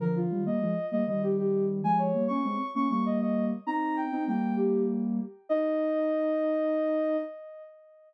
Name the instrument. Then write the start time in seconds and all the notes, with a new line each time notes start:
ocarina
0.00 D3 F3 A#4
0.16 F4
0.31 D#3 G3
0.46 G3 A#3 D#5
0.61 F3 G#3
0.92 G3 A#3 D#5
1.07 D#3 G3 D#5
1.22 G4
1.38 G4
1.83 F3 G#3 G#5
1.98 C#5
2.14 G3 A#3
2.28 A#3 C#4 C#6
2.44 G#3 C4
2.75 A#3 C#4 C#6
2.90 G3 A#3 C#6
3.05 D#5
3.21 D#5
3.66 C4 D#4 A#5
3.96 G5
4.12 C4 D#4
4.27 G3 A#3 G5
4.56 G4
5.49 D#4 D#5